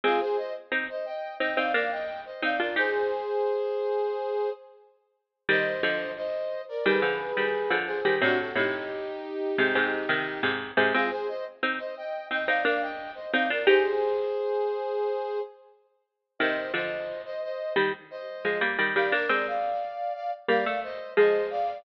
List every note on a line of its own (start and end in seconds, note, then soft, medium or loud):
0.04 0.20 G#3 medium
0.04 0.20 C4 loud
0.04 0.21 F4 medium
0.04 0.20 G#4 loud
0.20 0.37 G#4 medium
0.20 0.37 C5 loud
0.37 0.53 C5 medium
0.37 0.53 D#5 medium
0.72 0.88 C4 medium
0.72 0.88 D#4 medium
0.90 1.06 C5 medium
0.90 1.05 D#5 medium
1.06 1.35 D#5 medium
1.06 1.35 G5 medium
1.40 1.57 C4 medium
1.40 1.57 D#4 medium
1.40 1.57 D#5 medium
1.40 1.57 G5 medium
1.56 1.73 C4 medium
1.56 1.73 D#4 loud
1.56 1.72 D5 medium
1.56 1.72 F5 medium
1.74 2.37 A#3 medium
1.74 2.37 D4 medium
1.74 1.90 D5 medium
1.74 1.90 F5 medium
1.91 2.21 D#5 medium
1.91 2.21 G5 medium
2.26 2.42 C5 medium
2.26 2.42 D#5 medium
2.42 2.59 C4 medium
2.42 2.59 D#4 loud
2.42 2.59 D5 medium
2.42 2.60 F5 medium
2.60 2.76 D4 medium
2.60 2.76 F4 medium
2.60 2.76 A#4 medium
2.60 2.76 D5 medium
2.76 3.63 D#4 loud
2.76 3.63 G4 loud
2.76 4.50 G#4 medium
2.76 4.50 C5 loud
5.49 5.81 D#3 medium
5.49 5.81 G3 loud
5.49 6.11 C5 medium
5.49 6.11 D#5 loud
5.83 6.76 D3 medium
5.83 6.76 F3 loud
6.17 6.62 C5 medium
6.17 6.62 D#5 medium
6.69 6.85 A#4 medium
6.69 6.85 D5 medium
6.86 7.02 D#3 medium
6.86 7.02 G3 loud
6.86 7.75 G#4 medium
6.86 7.75 B4 medium
7.02 7.32 D3 medium
7.02 7.32 F3 medium
7.37 7.68 D#3 medium
7.37 7.68 G3 medium
7.70 8.00 D3 medium
7.70 8.00 F3 medium
7.87 8.15 G#4 medium
7.87 8.15 C5 medium
8.05 8.21 D#3 medium
8.05 8.21 G3 medium
8.21 8.53 A2 loud
8.21 8.53 C3 loud
8.21 8.38 D4 loud
8.21 8.38 F#4 loud
8.39 8.56 F#4 medium
8.39 8.56 A4 medium
8.55 9.50 A2 medium
8.55 9.50 C3 medium
8.55 10.50 D#4 medium
8.55 10.50 G4 medium
9.58 9.75 G#2 medium
9.58 9.75 C3 loud
9.75 10.06 G#2 medium
9.75 10.06 C3 loud
10.09 10.40 C3 medium
10.09 10.40 D#3 medium
10.43 10.71 G#2 medium
10.43 10.71 C3 loud
10.77 10.93 G#2 loud
10.77 10.93 C3 loud
10.93 11.11 G#3 medium
10.93 11.11 C4 loud
10.93 11.09 F4 medium
10.93 11.09 G#4 loud
11.11 11.27 G#4 medium
11.11 11.27 C5 loud
11.28 11.44 C5 medium
11.28 11.44 D#5 medium
11.63 11.79 C4 medium
11.63 11.79 D#4 medium
11.79 11.95 C5 medium
11.79 11.95 D#5 medium
11.97 12.26 D#5 medium
11.97 12.26 G5 medium
12.31 12.47 C4 medium
12.31 12.47 D#4 medium
12.31 12.48 D#5 medium
12.31 12.48 G5 medium
12.47 12.64 C4 medium
12.47 12.64 D#4 loud
12.47 12.63 D5 medium
12.47 12.63 F5 medium
12.65 13.27 A#3 medium
12.65 13.27 D4 medium
12.65 12.81 D5 medium
12.65 12.81 F5 medium
12.81 13.11 D#5 medium
12.81 13.11 G5 medium
13.15 13.31 C5 medium
13.15 13.31 D#5 medium
13.32 13.50 C4 medium
13.32 13.50 D#4 loud
13.32 13.48 D5 medium
13.32 13.48 F5 medium
13.50 13.66 D4 medium
13.50 13.66 F4 medium
13.50 13.67 A#4 medium
13.50 13.67 D5 medium
13.67 14.54 D#4 loud
13.67 14.54 G4 loud
13.67 15.39 G#4 medium
13.67 15.39 C5 loud
16.39 16.71 C3 medium
16.39 16.71 D#3 loud
16.39 16.72 C5 medium
16.39 16.72 D#5 medium
16.74 17.57 D3 medium
16.74 17.57 F3 medium
16.74 17.21 C5 medium
16.74 17.21 D#5 medium
17.25 17.41 C5 medium
17.25 17.41 D#5 medium
17.43 17.73 C5 medium
17.43 17.73 D#5 medium
17.76 17.92 D#3 medium
17.76 17.92 G3 medium
18.11 18.58 C5 medium
18.11 18.58 D#5 medium
18.45 18.61 F3 medium
18.45 18.61 G#3 medium
18.61 18.77 G3 medium
18.61 18.77 A#3 loud
18.79 18.95 D#3 medium
18.79 18.95 G3 medium
18.95 19.12 D#3 medium
18.95 19.12 G3 medium
18.95 19.12 D5 medium
18.95 19.12 F5 medium
19.12 19.29 A#3 medium
19.12 19.29 D4 loud
19.12 19.46 A#4 medium
19.12 19.46 D5 loud
19.29 20.37 G#3 medium
19.29 20.37 C4 medium
19.47 20.13 D5 medium
19.47 20.13 F5 medium
20.15 20.31 D5 medium
20.15 20.31 F5 medium
20.48 20.65 G3 medium
20.48 20.65 A#3 loud
20.48 20.80 D5 medium
20.48 20.80 F5 medium
20.66 20.98 A3 loud
20.83 21.12 C5 medium
20.83 21.12 D#5 medium
21.17 21.83 F3 medium
21.17 21.83 G#3 loud
21.17 21.47 C5 medium
21.17 21.47 D#5 medium
21.50 21.78 D5 medium
21.50 21.78 F5 loud